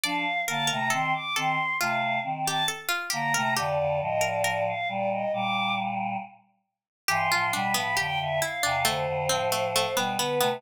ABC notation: X:1
M:4/4
L:1/16
Q:1/4=68
K:Gm
V:1 name="Choir Aahs"
f2 a b c' d' c'2 f2 z a z2 b2 | d2 e d d f d e d'2 z6 | [K:Am] c'2 b b g e f2 c6 B2 |]
V:2 name="Harpsichord"
d2 B B A2 A2 F3 G A F G B | G3 B B6 z6 | [K:Am] G F D B, G2 E D A,2 C A, A, B, B, B, |]
V:3 name="Choir Aahs"
[F,D] z [D,B,] [C,A,] [E,C] z [E,C] z [C,A,]2 [E,C]2 z2 [D,B,] [C,A,] | [F,,D,] [F,,D,] [A,,F,]4 [B,,G,]2 [B,,G,]4 z4 | [K:Am] [G,,E,] [A,,F,] [B,,G,] [A,,F,] [F,,D,] [F,,D,] z [E,,C,] [F,,D,] [F,,D,] [A,,F,]3 [B,,G,] [D,B,] [C,A,] |]